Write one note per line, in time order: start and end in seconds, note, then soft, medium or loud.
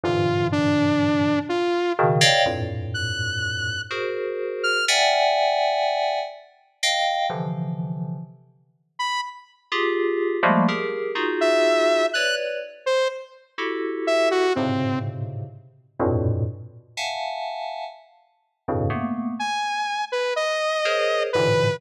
0.03 1.34 G2 medium
0.03 1.34 G#2 medium
0.03 1.34 A#2 medium
0.03 1.34 C3 medium
0.03 1.34 D3 medium
0.03 1.34 E3 medium
0.03 0.47 F4 medium
0.52 1.39 D4 medium
1.49 1.93 F4 medium
1.99 2.20 B2 loud
1.99 2.20 C#3 loud
1.99 2.20 D#3 loud
2.21 2.43 C#5 loud
2.21 2.43 D5 loud
2.21 2.43 D#5 loud
2.21 2.43 F5 loud
2.21 2.43 G5 loud
2.46 3.76 F2 medium
2.46 3.76 G2 medium
2.46 3.76 A2 medium
2.46 3.76 A#2 medium
2.94 3.81 F#6 medium
3.91 4.78 F#4 medium
3.91 4.78 G#4 medium
3.91 4.78 A#4 medium
3.91 4.78 C5 medium
4.64 4.85 F6 loud
4.88 6.19 D5 medium
4.88 6.19 E5 medium
4.88 6.19 F#5 medium
4.88 6.19 G5 medium
4.88 6.19 G#5 medium
6.83 7.26 D#5 medium
6.83 7.26 F5 medium
6.83 7.26 G5 medium
7.30 8.17 C3 medium
7.30 8.17 D3 medium
7.30 8.17 E3 medium
7.30 8.17 F3 medium
8.99 9.21 B5 medium
9.72 10.37 F4 medium
9.72 10.37 G4 medium
9.72 10.37 G#4 medium
10.43 10.65 F3 loud
10.43 10.65 G3 loud
10.43 10.65 G#3 loud
10.43 10.65 A3 loud
10.43 10.65 A#3 loud
10.68 11.12 G4 medium
10.68 11.12 G#4 medium
10.68 11.12 A#4 medium
11.15 12.02 D#4 medium
11.15 12.02 F4 medium
11.15 12.02 F#4 medium
11.15 12.02 G#4 medium
11.41 12.06 E5 loud
12.14 12.58 B4 medium
12.14 12.58 C#5 medium
12.14 12.58 D5 medium
12.14 12.35 F#6 loud
12.86 13.08 C5 loud
13.58 14.45 E4 medium
13.58 14.45 F#4 medium
13.58 14.45 G4 medium
13.58 14.45 A4 medium
14.07 14.29 E5 loud
14.31 14.53 F#4 loud
14.55 15.44 G#2 medium
14.55 15.44 A2 medium
14.55 15.44 B2 medium
14.55 15.44 C3 medium
14.55 15.44 C#3 medium
14.55 14.99 C4 medium
16.00 16.43 F2 medium
16.00 16.43 G2 medium
16.00 16.43 A2 medium
16.00 16.43 A#2 medium
16.00 16.43 B2 medium
16.97 17.84 E5 soft
16.97 17.84 F5 soft
16.97 17.84 F#5 soft
16.97 17.84 G#5 soft
16.97 17.84 A5 soft
18.68 18.90 F2 medium
18.68 18.90 G2 medium
18.68 18.90 A2 medium
18.68 18.90 B2 medium
18.68 18.90 C#3 medium
18.90 19.33 A3 medium
18.90 19.33 A#3 medium
18.90 19.33 B3 medium
19.39 20.05 G#5 medium
20.12 20.34 B4 medium
20.36 21.23 D#5 medium
20.85 21.29 G#4 medium
20.85 21.29 A#4 medium
20.85 21.29 C5 medium
20.85 21.29 C#5 medium
21.33 21.79 G#2 medium
21.33 21.79 A2 medium
21.33 21.79 A#2 medium
21.33 21.79 C3 medium
21.33 21.79 D3 medium
21.33 21.79 E3 medium
21.33 21.76 B4 loud